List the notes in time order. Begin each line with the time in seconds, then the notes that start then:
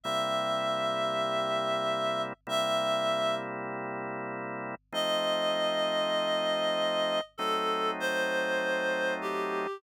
0.04 C3 G3 A#3 E4 E5
2.47 C3 G3 A#3 E4 E5
4.92 F3 A3 C4 D#4 D#5
7.38 F#3 A3 C4 D#4 A4
8.00 C5
9.21 G4